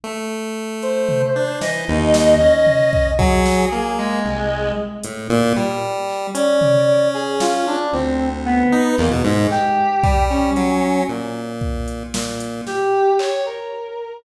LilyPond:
<<
  \new Staff \with { instrumentName = "Brass Section" } { \time 6/8 \tempo 4. = 76 r4. c''4. | dis''2. | gis'4. gis4. | r2. |
d''4. gis'8 f'8 d'8 | c'8. r16 b4 ais16 r16 gis8 | g'4. cis'4. | r2. |
g'4 cis''8 ais'4. | }
  \new Staff \with { instrumentName = "Lead 1 (square)" } { \time 6/8 a2~ a8 d'8 | e8 dis,4 cis'4. | fis4 ais4 c,4 | r8 a,8 ais,8 g4. |
cis'2. | d,4. dis'8 e,16 b,16 gis,8 | r4 g4 fis4 | ais,2 ais,4 |
r2. | }
  \new DrumStaff \with { instrumentName = "Drums" } \drummode { \time 6/8 r4. hh8 tomfh4 | sn4 sn8 r8 tomfh8 bd8 | bd8 sn4 r4. | r8 hh4 r4 hc8 |
hh8 tomfh4 r8 sn4 | r4. r8 hc4 | hc4 bd8 r8 hh4 | r4 bd8 hh8 sn8 hh8 |
sn4 hc8 r4. | }
>>